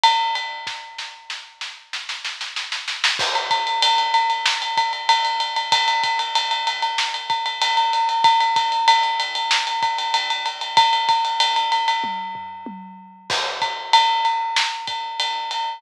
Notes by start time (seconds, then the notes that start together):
0.03 ride
0.35 ride
0.67 kick, snare
0.98 snare
1.30 snare
1.61 snare
1.93 snare
2.09 snare
2.25 snare
2.41 snare
2.56 snare
2.72 snare
2.88 snare
3.04 snare
3.19 kick, crash
3.35 ride
3.51 kick, ride
3.67 ride
3.82 ride
3.98 ride
4.14 ride
4.30 ride
4.46 snare
4.62 ride
4.77 kick, ride
4.93 ride
5.09 ride
5.25 ride
5.40 ride
5.56 ride
5.72 kick, ride
5.88 ride
6.03 kick, ride
6.19 ride
6.35 ride
6.51 ride
6.67 ride
6.82 ride
6.98 snare
7.14 ride
7.30 kick, ride
7.46 ride
7.61 ride
7.77 ride
7.93 ride
8.09 ride
8.24 kick, ride
8.40 ride
8.56 kick, ride
8.72 ride
8.88 ride
9.03 ride
9.20 ride
9.35 ride
9.51 snare
9.67 ride
9.83 kick, ride
9.98 ride
10.14 ride
10.30 ride
10.46 ride
10.61 ride
10.77 kick, ride
10.93 ride
11.09 kick, ride
11.25 ride
11.40 ride
11.56 ride
11.72 ride
11.88 ride
12.04 kick, high tom
12.35 floor tom
12.66 high tom
13.30 kick, crash
13.62 kick, ride
13.93 ride
14.25 ride
14.56 snare
14.87 kick, ride
15.20 ride
15.51 ride